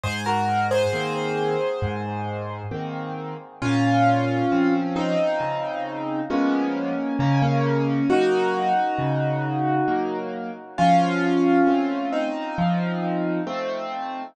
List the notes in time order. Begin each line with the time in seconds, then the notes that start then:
0.04 G#2 G#4 C5
0.26 F#4 A#4
0.71 G#4 C5
0.93 D#3 A#3 C4
1.82 G#2
2.71 D#3 A#3 C4
3.62 A#2 C#4 F4
4.52 F3 C4 C#4
4.96 C4 D#4
5.40 C#3
6.30 F3 G#3 A#3 B3 C#4
7.19 C#3 A#3 C#4
7.42 A#3 C#4
8.10 F#3 A#3 D#4 F#4
8.99 C#3
9.88 F#3 A#3
10.78 F3 C#4 F4
11.67 A3 C4
12.12 C4 D#4
12.58 F3
13.47 A3 C4